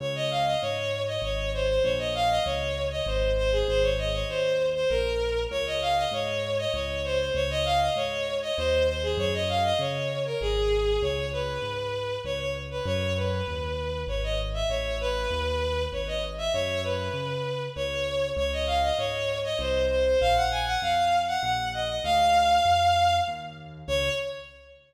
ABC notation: X:1
M:3/4
L:1/16
Q:1/4=98
K:Db
V:1 name="Violin"
d e f e d3 e d2 c c | d e f e d3 e c2 c A | c d e d c3 c B4 | d e f e d3 e d2 c c |
d e f e d3 e c2 c A | d e f e d3 B A4 | [K:C#m] c2 B6 c c z B | c2 B6 c d z e |
c2 B6 c d z e | c2 B6 c4 | [K:Db] d e f e d3 e c2 c c | f g a g f3 g g2 e e |
f8 z4 | d4 z8 |]
V:2 name="Acoustic Grand Piano" clef=bass
D,,4 A,,4 A,,,4 | B,,,4 D,,4 A,,,4 | A,,,4 E,,4 B,,,4 | D,,4 A,,4 D,,4 |
D,,4 A,,4 E,,4 | G,,4 D,4 A,,,4 | [K:C#m] C,,4 G,,4 C,,4 | F,,4 D,,4 G,,,4 |
A,,,4 D,,4 G,,,4 | F,,4 C,4 C,,4 | [K:Db] D,,4 A,,4 C,,4 | B,,,4 F,,4 B,,,4 |
=D,,4 F,,4 E,,4 | D,,4 z8 |]